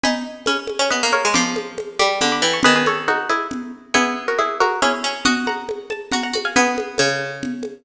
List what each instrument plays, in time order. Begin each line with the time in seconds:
0.04 pizzicato strings D#4 G#5 B5, low conga
0.46 pizzicato strings C#4 G#5 B5, high conga
0.67 high conga
0.79 pizzicato strings C#4
0.90 pizzicato strings B3 B4 D#5, low conga
1.03 pizzicato strings A#3
1.12 pizzicato strings A#4 C#5, high conga
1.25 pizzicato strings G#3
1.34 pizzicato strings F3 B5 D6, low conga
1.56 high conga
1.78 high conga
1.99 pizzicato strings G3 B5 D6, high conga
2.21 pizzicato strings D3 B5 D6, low conga
2.32 pizzicato strings B5 D6
2.42 pizzicato strings E3 G5 B5
2.53 pizzicato strings A5 C#6
2.63 pizzicato strings D#3 G#4 B4, low conga
2.76 pizzicato strings G#4 B4
2.86 pizzicato strings A4 C#5, high conga
3.08 pizzicato strings D#4 F#4, high conga
3.30 pizzicato strings E4 G#4, high conga
3.51 low conga
3.94 pizzicato strings B3 E4 G#4, low conga
4.28 pizzicato strings F#4 A#4
4.39 pizzicato strings E4 G#4, high conga
4.60 pizzicato strings F#4 A#4, high conga
4.82 pizzicato strings C#4 E4 G#4, low conga
5.04 pizzicato strings C#4
5.25 pizzicato strings F#4 D#5 F#5, low conga
5.47 pizzicato strings F#5 A#5, high conga
5.69 high conga
5.90 pizzicato strings A5, high conga
6.12 pizzicato strings F#4 F#5 A#5, low conga
6.23 pizzicato strings F#5 A#5
6.33 pizzicato strings F#4, high conga
6.45 pizzicato strings F5 G#5
6.56 pizzicato strings B3 G#4 B4, low conga
6.78 high conga
6.98 pizzicato strings C#3, high conga
7.43 low conga
7.63 high conga